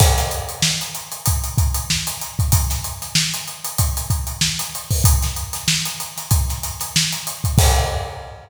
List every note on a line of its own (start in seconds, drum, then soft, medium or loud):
0.00 kick medium
0.00 crash loud
0.18 snare soft
0.18 closed hi-hat medium
0.31 closed hi-hat medium
0.49 closed hi-hat medium
0.62 snare medium
0.81 closed hi-hat medium
0.95 closed hi-hat medium
1.12 closed hi-hat medium
1.26 kick medium
1.26 closed hi-hat medium
1.44 closed hi-hat medium
1.58 kick medium
1.58 closed hi-hat medium
1.74 closed hi-hat medium
1.90 snare medium
2.07 closed hi-hat medium
2.21 closed hi-hat medium
2.39 kick medium
2.39 closed hi-hat medium
2.52 kick medium
2.52 closed hi-hat medium
2.70 snare soft
2.70 closed hi-hat medium
2.84 closed hi-hat medium
3.02 snare soft
3.02 closed hi-hat medium
3.15 snare medium
3.34 snare soft
3.34 closed hi-hat medium
3.48 closed hi-hat medium
3.64 closed hi-hat medium
3.78 kick medium
3.78 closed hi-hat medium
3.97 closed hi-hat medium
4.10 kick medium
4.10 closed hi-hat medium
4.27 closed hi-hat medium
4.41 snare medium
4.59 closed hi-hat medium
4.75 closed hi-hat medium
4.91 kick medium
4.91 open hi-hat medium
5.04 kick medium
5.04 closed hi-hat loud
5.22 snare soft
5.22 closed hi-hat medium
5.36 closed hi-hat medium
5.53 snare soft
5.53 closed hi-hat medium
5.68 snare medium
5.85 closed hi-hat medium
6.00 closed hi-hat medium
6.17 snare soft
6.17 closed hi-hat medium
6.31 kick medium
6.31 closed hi-hat medium
6.49 snare soft
6.49 closed hi-hat medium
6.63 snare soft
6.63 closed hi-hat medium
6.80 snare soft
6.80 closed hi-hat medium
6.96 snare medium
7.13 closed hi-hat medium
7.27 closed hi-hat medium
7.44 kick medium
7.44 closed hi-hat medium
7.58 kick loud
7.58 crash loud